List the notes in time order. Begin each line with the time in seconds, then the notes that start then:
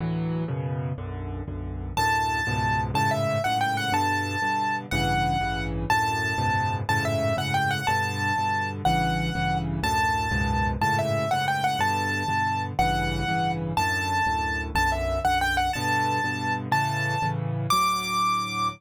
0.00 D2 A2 E3 F#3
0.48 F#2 B2 C#3
0.98 B1 F#2 D3
1.48 B1 F#2 D3
1.97 D2 F#2 A2 A5
2.47 C#2 F#2 G#2 B2
2.94 F#2 G#2 A2 C#3 A5
3.11 E5
3.44 F#2 G#2 A2 C#3 F#5
3.61 G5
3.77 F#5
3.92 G2 B2 D3 A5
4.42 G2 B2 D3
4.91 A1 G2 C#3 E3 F#5
5.41 A1 G2 C#3 E3
5.90 D2 F#2 A2 A5
6.38 C#2 F#2 G#2 B2
6.89 F#2 G#2 A2 C#3 A5
7.05 E5
7.37 F#2 G#2 A2 C#3 F#5
7.54 G5
7.71 F#5
7.87 G2 B2 D3 A5
8.38 G2 B2 D3
8.85 A1 G2 C#3 E3 F#5
9.35 A1 G2 C#3 E3
9.83 D2 F#2 A2 A5
10.31 C#2 F#2 G#2 B2
10.81 F#2 G#2 A2 C#3 A5
10.99 E5
11.31 F#2 G#2 A2 C#3 F#5
11.48 G5
11.64 F#5
11.79 G2 B2 D3 A5
12.28 G2 B2 D3
12.79 A1 G2 C#3 E3 F#5
13.28 A1 G2 C#3 E3
13.77 D2 F#2 A2 A5
14.26 D2 F#2 A2
14.75 B1 F#2 D3 A5
14.92 E5
15.25 B1 F#2 D3 F#5
15.41 G5
15.57 F#5
15.73 G2 B2 D3 A5
16.24 G2 B2 D3
16.72 A2 C#3 E3 A5
17.22 A2 C#3 E3
17.70 D2 A2 F#3 D6